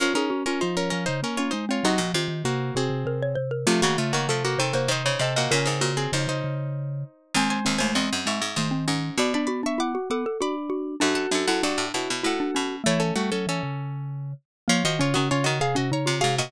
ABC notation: X:1
M:3/4
L:1/16
Q:1/4=98
K:Bbm
V:1 name="Pizzicato Strings"
[DB] [DB]2 [DB] [Ec] [DB] [DB] [Ec] [DB] [Fd] [Ec] [Fd] | [Ge]2 z2 [B,G]2 [CA]4 z2 | [=A,F] [B,G] [A,F] [B,G] [A,F] [B,G] [C=A] [B,G] [Ec]2 [CA] [B,G] | [DB] [CA]2 [CA] [Ec] [Ec]7 |
[K:Bm] [^B^g] [Bg] [Bg] [Bg] [^d^b]2 [ec']2 [Bg]4 | [db] [db] [db] [ec'] [fd']2 [fd']2 [db]4 | [Af] [Af] [Af] [Af] [Fd]2 [Ec]2 [Af]4 | [Ec] [CA] [A,F] [CA] [CA]6 z2 |
[K:Bbm] [Fd] [Ge] [Fd] [Ge] [Fd] [Ge] [Af] [Ge] [db]2 [Af] [Ge] |]
V:2 name="Xylophone"
B A G F F3 z2 D z C | E z F2 z2 G2 B d c B | =A,4 =A2 c c c d e e | B2 G8 z2 |
[K:Bm] ^B,2 B, A, B,4 A, B, C2 | F D F D E F A A F z F2 | D2 D E D4 E D C2 | A,6 z6 |
[K:Bbm] B, z D D D z2 D E F G2 |]
V:3 name="Vibraphone"
F E D D F,2 F, D, B,2 A,2 | G, F, E, E, C,2 C, C, C,2 C,2 | F, E, D, D, C,2 C, C, C,2 C,2 | D,4 D, D, D,4 z2 |
[K:Bm] ^G,6 G, z ^D,4 | B,6 B, z D4 | F6 F z F4 | E,2 G, F, E, C,5 z2 |
[K:Bbm] F, E, D, D, D,2 C, C, D,2 C,2 |]
V:4 name="Pizzicato Strings"
F,12 | C, B,, C,6 z4 | C, D, z E, F,2 E,2 E, D, C, B,, | B,, A,, B,,2 F,,6 z2 |
[K:Bm] ^D,,2 D,, D,, E,, F,, ^G,, G,, G,,2 G,,2 | B,,10 z2 | F,,2 F,, F,, G,, A,, B,, B,, A,,2 B,,2 | A,6 z6 |
[K:Bbm] F, F,2 E, z E,4 C, A,, B,, |]